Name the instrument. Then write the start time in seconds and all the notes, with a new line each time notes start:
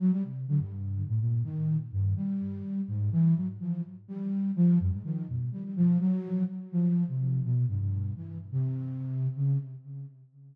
flute
0.00 F#3
0.12 G3
0.24 C3
0.48 D3
0.60 G2
1.08 A2
1.20 A#2
1.44 D#3
1.92 G2
2.16 G3
2.88 G#2
3.12 E3
3.36 F#3
3.60 F3
4.08 G3
4.56 F3
4.80 F#2
4.92 G#2
5.04 D#3
5.28 B2
5.52 G3
5.64 G3
5.76 F3
6.00 F#3
6.72 F3
7.08 C3
7.44 B2
7.68 G2
7.80 G2
8.16 E3
8.52 C3
9.36 C#3